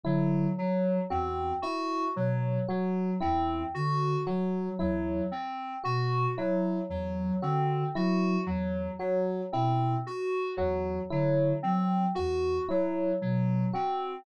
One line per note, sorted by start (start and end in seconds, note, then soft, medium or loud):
0.04 0.46 D3 medium
0.04 0.47 F#3 medium
0.04 0.47 E4 medium
0.57 0.99 F#3 medium
0.57 1.00 F#3 medium
1.10 1.52 E2 medium
1.10 1.52 C4 medium
1.10 1.52 F#4 medium
1.62 2.05 E4 medium
1.62 2.04 F#4 medium
2.16 2.58 B2 medium
2.16 2.58 F#3 medium
2.69 3.11 F#3 medium
2.69 3.11 F#4 medium
3.21 3.64 E2 medium
3.21 3.63 C4 medium
3.21 3.63 E4 medium
3.75 4.17 D3 medium
3.75 4.17 F#4 medium
4.26 4.68 F#3 medium
4.26 4.70 F#3 medium
4.26 4.69 F#4 medium
4.79 5.21 E2 medium
4.79 5.21 F#3 medium
4.79 5.21 E4 medium
5.32 5.74 C4 medium
5.84 6.27 B2 medium
5.84 6.26 F#4 medium
5.84 6.27 F#4 medium
6.37 6.79 F#3 medium
6.37 6.80 E4 medium
6.89 7.31 E2 medium
6.89 7.32 F#3 medium
7.42 7.84 D3 medium
7.42 7.84 C4 medium
7.42 7.84 F#4 medium
7.95 8.37 F#3 medium
7.95 8.38 E4 medium
7.95 8.38 F#4 medium
8.46 8.88 E2 medium
8.46 8.89 F#3 medium
8.99 9.41 F#3 medium
8.99 9.41 F#4 medium
9.52 9.96 B2 medium
9.52 9.95 C4 medium
9.52 9.96 E4 medium
10.07 10.49 F#4 medium
10.57 10.99 E2 medium
10.57 10.99 F#3 medium
10.57 11.00 F#4 medium
11.11 11.53 D3 medium
11.11 11.53 F#3 medium
11.11 11.53 E4 medium
11.63 12.05 F#3 medium
11.63 12.05 C4 medium
12.15 12.59 E2 medium
12.15 12.57 F#4 medium
12.15 12.58 F#4 medium
12.69 13.12 F#3 medium
12.69 13.11 E4 medium
13.21 13.64 B2 medium
13.21 13.64 F#3 medium
13.73 14.16 C4 medium
13.73 14.16 F#4 medium